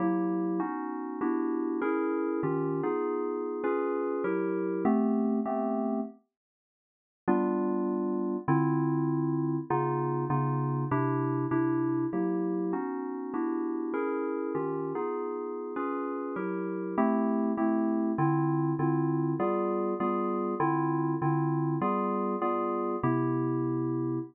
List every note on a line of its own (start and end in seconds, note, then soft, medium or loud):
0.00 0.59 F#3 medium
0.00 0.59 A#3 medium
0.00 0.59 E4 medium
0.00 0.59 G4 medium
0.60 1.19 B3 medium
0.60 1.19 C#4 medium
0.60 1.19 D#4 medium
0.60 1.19 F#4 medium
1.21 1.80 B3 medium
1.21 1.80 D4 medium
1.21 1.80 E4 medium
1.21 1.80 F#4 medium
1.21 1.80 G4 medium
1.81 2.41 C#4 medium
1.81 2.41 E4 medium
1.81 2.41 G#4 medium
1.81 2.41 A#4 medium
2.43 2.81 D#3 medium
2.43 2.81 C#4 medium
2.43 2.81 F4 medium
2.43 2.81 G4 medium
2.83 3.63 B3 medium
2.83 3.63 D#4 medium
2.83 3.63 F4 medium
2.83 3.63 G#4 medium
3.64 4.23 C#4 medium
3.64 4.23 F4 medium
3.64 4.23 G#4 medium
3.64 4.23 B4 medium
4.24 4.84 F#3 medium
4.24 4.84 E4 medium
4.24 4.84 G4 medium
4.24 4.84 A#4 medium
4.85 5.40 A3 loud
4.85 5.40 B3 loud
4.85 5.40 C4 loud
4.85 5.40 G4 loud
5.46 6.00 A3 loud
5.46 6.00 B3 medium
5.46 6.00 C4 loud
5.46 6.00 G4 medium
7.28 8.37 G3 loud
7.28 8.37 B3 loud
7.28 8.37 D4 loud
7.28 8.37 F4 loud
8.48 9.57 D3 loud
8.48 9.57 C4 loud
8.48 9.57 E4 loud
8.48 9.57 F4 loud
9.70 10.25 C#3 loud
9.70 10.25 B3 loud
9.70 10.25 D#4 loud
9.70 10.25 F4 loud
10.30 10.85 C#3 medium
10.30 10.85 B3 medium
10.30 10.85 D#4 medium
10.30 10.85 F4 loud
10.91 11.46 C3 loud
10.91 11.46 D4 loud
10.91 11.46 E4 loud
10.91 11.46 G4 loud
11.51 12.06 C3 medium
11.51 12.06 D4 medium
11.51 12.06 E4 loud
11.51 12.06 G4 medium
12.13 12.72 F#3 medium
12.13 12.72 A#3 medium
12.13 12.72 E4 medium
12.13 12.72 G4 medium
12.73 13.32 B3 medium
12.73 13.32 C#4 medium
12.73 13.32 D#4 medium
12.73 13.32 F#4 medium
13.34 13.93 B3 medium
13.34 13.93 D4 medium
13.34 13.93 E4 medium
13.34 13.93 F#4 medium
13.34 13.93 G4 medium
13.94 14.53 C#4 medium
13.94 14.53 E4 medium
13.94 14.53 G#4 medium
13.94 14.53 A#4 medium
14.55 14.93 D#3 medium
14.55 14.93 C#4 medium
14.55 14.93 F4 medium
14.55 14.93 G4 medium
14.95 15.75 B3 medium
14.95 15.75 D#4 medium
14.95 15.75 F4 medium
14.95 15.75 G#4 medium
15.76 16.35 C#4 medium
15.76 16.35 F4 medium
15.76 16.35 G#4 medium
15.76 16.35 B4 medium
16.36 16.95 F#3 medium
16.36 16.95 E4 medium
16.36 16.95 G4 medium
16.36 16.95 A#4 medium
16.98 17.52 A3 loud
16.98 17.52 C4 loud
16.98 17.52 E4 loud
16.98 17.52 G4 loud
17.57 18.12 A3 medium
17.57 18.12 C4 medium
17.57 18.12 E4 medium
17.57 18.12 G4 medium
18.18 18.73 D3 loud
18.18 18.73 C4 loud
18.18 18.73 E4 loud
18.18 18.73 F4 loud
18.79 19.34 D3 loud
18.79 19.34 C4 medium
18.79 19.34 E4 medium
18.79 19.34 F4 medium
19.40 19.94 G3 loud
19.40 19.94 B3 loud
19.40 19.94 F4 loud
19.40 19.94 G#4 medium
20.00 20.55 G3 medium
20.00 20.55 B3 medium
20.00 20.55 F4 medium
20.00 20.55 G#4 medium
20.60 21.14 D3 loud
20.60 21.14 C4 medium
20.60 21.14 E4 loud
20.60 21.14 F4 loud
21.22 21.76 D3 medium
21.22 21.76 C4 medium
21.22 21.76 E4 medium
21.22 21.76 F4 medium
21.81 22.36 G3 loud
21.81 22.36 B3 loud
21.81 22.36 F4 loud
21.81 22.36 G#4 medium
22.42 22.96 G3 medium
22.42 22.96 B3 medium
22.42 22.96 F4 medium
22.42 22.96 G#4 medium
23.03 24.19 C3 loud
23.03 24.19 B3 medium
23.03 24.19 E4 loud
23.03 24.19 G4 loud